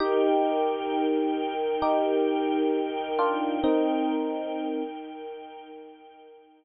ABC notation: X:1
M:4/4
L:1/8
Q:1/4=66
K:Eb
V:1 name="Electric Piano 1"
[EG]4 [EG]3 [DF] | [CE]3 z5 |]
V:2 name="String Ensemble 1"
[EBg]8- | [EBg]8 |]